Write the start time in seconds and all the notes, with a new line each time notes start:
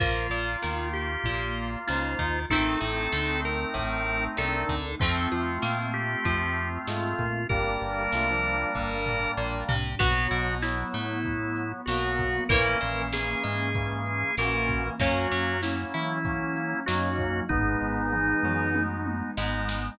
0.00 A#1 F3 A#3 F4, kick, crash
0.30 A#1 A#2, closed hi-hat
0.62 D#2 D#3, snare
0.93 G4, closed hi-hat
1.24 A#1 A#2, kick, closed hi-hat
1.56 closed hi-hat
1.87 C#2 C#3 D#4 F4 C5, snare
2.19 D#2 D#3, kick, closed hi-hat
2.50 A1 D#3 A3 C4 D#4 A4, kick, closed hi-hat
2.81 A1 A2, closed hi-hat
3.12 D2 D3, snare
3.44 A#4, closed hi-hat
3.74 A1 A2, kick, closed hi-hat
4.06 closed hi-hat
4.36 C2 C3 D4 A4 A#4, snare
4.69 D2 D3, kick, closed hi-hat
4.99 F2 F3 A3 C4 F4, kick, closed hi-hat
5.31 F2 F3, closed hi-hat
5.62 A#2 A#3, snare
5.94 G4, closed hi-hat
6.25 F2 F3, kick, closed hi-hat
6.56 closed hi-hat
6.87 G#2 G#3 A3 F4, snare
7.19 A#2 A#3, kick, closed hi-hat
7.49 G1 G3 A#3 D4 G4 A#4, kick, closed hi-hat
7.81 G1 G2, closed hi-hat
8.12 C2 C3 A3 F4, snare
8.28 F3 D4
8.43 closed hi-hat
8.75 G1 G2, kick
9.06 floor tom
9.37 A#1 A#2
9.69 C2 C3, floor tom
9.99 B1 F#3 B3 F#4, kick, crash
10.31 B1 B2, closed hi-hat
10.62 F#3 B3 E4, snare
10.94 A2 A3, closed hi-hat
11.25 F#3 B3, kick, closed hi-hat
11.56 closed hi-hat
11.86 B1 B2 F#3 A#3 B3 F#4, snare
12.19 kick, closed hi-hat
12.49 A#1 E3 A#3 C#4 A#4, kick, closed hi-hat
12.81 A#1 A#2, closed hi-hat
13.13 E3 A#3 C#4 G#4, snare
13.43 G#2 G#3, closed hi-hat
13.75 E3 A#3 C#4, kick, closed hi-hat
14.06 closed hi-hat
14.37 A#1 A#2 E3 A#3 C#4 F#4 A#4, snare
14.69 kick, closed hi-hat
14.99 F#2 F#3 A#3 C#4 F#4, kick, closed hi-hat
15.31 F#2 F#3, closed hi-hat
15.62 F#3 A#3 C#4 E4, snare
15.94 E3 E4, closed hi-hat
16.25 F#3 A#3 C#4, kick, closed hi-hat
16.56 closed hi-hat
16.86 F#2 F#3 A#3 C#4 D#4 F#4, snare
17.19 kick, closed hi-hat
17.49 G#1 G#3 B3 D#4 G#4, kick, floor tom
17.81 G#1 G#2
18.12 G#3 B3 D#4, mid tom
18.43 F#2 F#3, mid tom
18.75 G#3 B3 D#4, high tom
19.06 high tom
19.37 G#1 G#2 G#3 B3 D#4, snare
19.69 snare